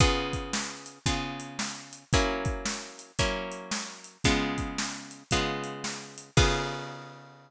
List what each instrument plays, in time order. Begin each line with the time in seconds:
0.00 acoustic guitar (steel) C#3 B3 F4 G#4, kick, closed hi-hat
0.33 kick, closed hi-hat
0.53 snare
0.86 closed hi-hat
1.06 acoustic guitar (steel) C#3 B3 F4 G#4, kick, closed hi-hat
1.40 closed hi-hat
1.59 snare
1.93 closed hi-hat
2.13 acoustic guitar (steel) F#3 A#3 C#4 E4, kick, closed hi-hat
2.45 kick, closed hi-hat
2.65 snare
2.99 closed hi-hat
3.19 acoustic guitar (steel) F#3 A#3 C#4 E4, kick, closed hi-hat
3.52 closed hi-hat
3.71 snare
4.04 closed hi-hat
4.24 acoustic guitar (steel) C#3 G#3 B3 F4, kick, closed hi-hat
4.58 kick, closed hi-hat
4.78 snare
5.11 closed hi-hat
5.31 acoustic guitar (steel) C#3 G#3 B3 F4, kick, closed hi-hat
5.64 closed hi-hat
5.84 snare
6.18 closed hi-hat
6.37 acoustic guitar (steel) C#3 B3 F4 G#4, kick, crash